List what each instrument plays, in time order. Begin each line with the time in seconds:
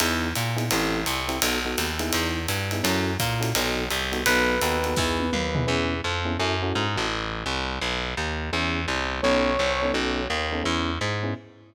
0.00 electric bass (finger) E2, electric piano 1 B3 D#4 E4 G#4, ride
0.35 electric bass (finger) A#2, hi-hat pedal, ride
0.57 electric piano 1 B3 D#4 E4 G#4, ride
0.71 electric bass (finger) A1, electric piano 1 C4 E4 G4 A4, ride
1.06 electric bass (finger) C2, hi-hat pedal, ride
1.28 electric piano 1 C4 E4 G4 A4, ride
1.42 electric bass (finger) B1, electric piano 1 B3 D#4 F#4 A4, ride
1.65 electric piano 1 B3 D#4 F#4 A4
1.78 electric bass (finger) D#2, hi-hat pedal, ride
1.99 electric piano 1 B3 D#4 E4 G#4, ride
2.13 electric bass (finger) E2, ride
2.48 electric bass (finger) G2, hi-hat pedal, ride
2.71 electric piano 1 B3 D#4 E4 G#4, ride
2.83 electric bass (finger) F#2, electric piano 1 C#4 E4 F#4 A4, ride
3.19 electric bass (finger) A#2, kick, hi-hat pedal, ride
3.40 electric piano 1 C#4 E4 F#4 A4, ride
3.55 electric bass (finger) B1, electric piano 1 B3 D#4 F#4 A4, ride
3.90 electric bass (finger) C2, hi-hat pedal, ride
4.12 electric piano 1 B3 D#4 F#4 A4, ride
4.26 electric bass (finger) B1, electric piano 1 B3 D#4 F#4 A4 B4, ride
4.61 electric bass (finger) D#2, electric piano 1 B3 D#4 F#4 A4, hi-hat pedal, ride
4.84 electric piano 1 B3 D#4 F#4 A4, ride
4.96 electric bass (finger) E2, electric piano 1 B3 D#4 E4 G#4, kick, snare
5.19 high tom
5.33 electric bass (finger) D#2, mid tom
5.55 electric piano 1 B3 D#4 E4 G#4, floor tom
5.67 electric bass (finger) E2, electric piano 1 B3 C#4 E4 G#4
6.04 electric bass (finger) F2
6.25 electric piano 1 B3 C#4 E4 G#4
6.39 electric bass (finger) F#2, electric piano 1 C#4 E4 F#4 A4
6.62 electric piano 1 C#4 E4 F#4 A4
6.75 electric bass (finger) G#2
6.96 electric bass (finger) A1, electric piano 1 C#4 E4 F#4 A4
7.46 electric bass (finger) C2
7.82 electric bass (finger) B1
8.17 electric bass (finger) D#2
8.53 electric bass (finger) E2, electric piano 1 B3 C#4 E4 G#4
8.88 electric bass (finger) C2
9.22 electric bass (finger) B1, electric piano 1 B3 C#4 D#4 A4, brass section C#5
9.59 electric bass (finger) C2
9.82 electric piano 1 B3 C#4 D#4 A4
9.94 electric bass (finger) B1, electric piano 1 B3 C#4 D#4 A4
10.30 electric bass (finger) D#2
10.52 electric piano 1 B3 C#4 D#4 A4
10.64 electric bass (finger) E2, electric piano 1 B3 C#4 E4 G#4
11.01 electric bass (finger) G#2
11.23 electric piano 1 B3 C#4 E4 G#4